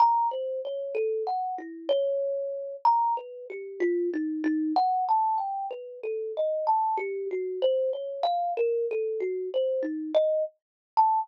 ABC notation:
X:1
M:4/4
L:1/16
Q:1/4=63
K:none
V:1 name="Kalimba"
(3^a2 c2 ^c2 (3=A2 ^f2 E2 c4 (3^a2 B2 G2 | (3F2 ^D2 D2 (3^f2 a2 g2 (3B2 A2 ^d2 (3a2 G2 ^F2 | (3c2 ^c2 f2 (3^A2 =A2 ^F2 (3=c2 ^D2 ^d2 z2 a z |]